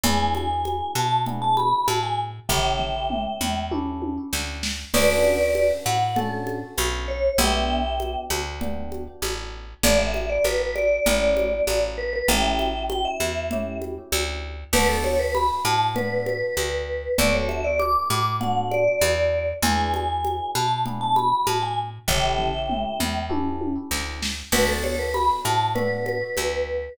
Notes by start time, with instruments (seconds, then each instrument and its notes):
0.03 electric bass (finger) E2, electric piano 1 B3 D4 E4 G#4, vibraphone G#5, low conga
0.35 vibraphone G#5, high conga
0.65 high conga
0.95 electric bass (finger) B2, vibraphone A5, high conga
1.26 electric piano 1 B3 D4 E4 G#4, low conga
1.42 vibraphone A5
1.57 vibraphone B5, high conga
1.88 electric bass (finger) A2, vibraphone A5, high conga
2.03 vibraphone G#5
2.49 electric bass (finger) A1, electric piano 1 C#4 E4 G4 A4, vibraphone E5 G5, kick, floor tom
2.79 floor tom
3.10 mid tom
3.41 electric bass (finger) E2, mid tom
3.71 electric piano 1 C#4 E4 G4 A4, high tom
4.02 high tom
4.33 electric bass (finger) D2, snare
4.63 snare
4.94 electric bass (finger) D2, electric piano 1 C#4 D4 F#4 A4, vibraphone B4 D5, crash, low conga
5.24 high conga
5.55 high conga
5.86 electric bass (finger) A2, vibraphone F#5, high conga
6.16 electric piano 1 C#4 D4 F#4 A4, vibraphone A4, low conga
6.47 high conga
6.78 electric bass (finger) B1, high conga
7.08 vibraphone C#5
7.38 electric bass (finger) B1, electric piano 1 B3 D4 G4, vibraphone E5 G5, low conga
8.00 high conga
8.30 electric bass (finger) D2, high conga
8.61 electric piano 1 B3 D4 G4, low conga
8.92 high conga
9.22 electric bass (finger) A1, high conga
9.83 electric bass (finger) A1, electric piano 1 A3 D4 E4 G4, vibraphone D5, low conga
9.99 vibraphone E5
10.14 high conga
10.29 vibraphone D5
10.44 electric bass (finger) A1, vibraphone B4, high conga
10.60 vibraphone B4
10.75 vibraphone D5, high conga
11.06 electric bass (finger) A1, electric piano 1 A3 C#4 E4 G4, low conga
11.37 high conga
11.67 electric bass (finger) A1, high conga
11.98 vibraphone B4
12.13 vibraphone B4
12.28 electric bass (finger) A1, electric piano 1 A3 C#4 E4 G4, vibraphone E5 G5, low conga
12.59 high conga
12.90 vibraphone G5, high conga
13.05 vibraphone E5
13.20 electric bass (finger) E2, high conga
13.51 electric piano 1 A3 C#4 E4 G4, low conga
13.82 high conga
14.12 electric bass (finger) D2, high conga
14.73 electric bass (finger) D2, electric piano 1 B3 D4 F#4 A4, vibraphone B4, crash, low conga
14.89 vibraphone A4
15.04 vibraphone C#5, high conga
15.19 vibraphone B4
15.35 vibraphone B5, high conga
15.65 electric bass (finger) A2, vibraphone A5, high conga
15.94 electric piano 1 B3 D4 F#4 A4, vibraphone B4, low conga
16.26 vibraphone B4, high conga
16.57 electric bass (finger) D2, high conga
17.18 electric bass (finger) D2, electric piano 1 B3 D4 F#4 A4, vibraphone D5, low conga
17.34 vibraphone C#5
17.49 vibraphone E5, high conga
17.64 vibraphone D5
17.79 vibraphone D6, high conga
18.10 electric bass (finger) A2, vibraphone D6, high conga
18.41 electric piano 1 B3 D4 F#4 A4, vibraphone F#5, low conga
18.71 vibraphone D5, high conga
19.01 electric bass (finger) E2, high conga
19.62 electric bass (finger) E2, electric piano 1 B3 D4 E4 G#4, vibraphone G#5, low conga
19.94 vibraphone G#5, high conga
20.24 high conga
20.55 electric bass (finger) B2, vibraphone A5, high conga
20.86 electric piano 1 B3 D4 E4 G#4, low conga
21.01 vibraphone A5
21.16 vibraphone B5, high conga
21.47 electric bass (finger) A2, vibraphone A5, high conga
21.62 vibraphone G#5
22.08 electric bass (finger) A1, electric piano 1 C#4 E4 G4 A4, vibraphone E5 G5, kick, floor tom
22.39 floor tom
22.69 mid tom
23.00 electric bass (finger) E2, mid tom
23.29 electric piano 1 C#4 E4 G4 A4, high tom
23.61 high tom
23.91 electric bass (finger) D2, snare
24.22 snare
24.52 electric bass (finger) D2, electric piano 1 B3 D4 F#4 A4, vibraphone B4, crash, low conga
24.68 vibraphone A4
24.84 vibraphone C#5, high conga
24.99 vibraphone B4
25.14 vibraphone B5, high conga
25.45 electric bass (finger) A2, vibraphone A5, high conga
25.75 electric piano 1 B3 D4 F#4 A4, vibraphone B4, low conga
26.06 vibraphone B4, high conga
26.37 electric bass (finger) D2, high conga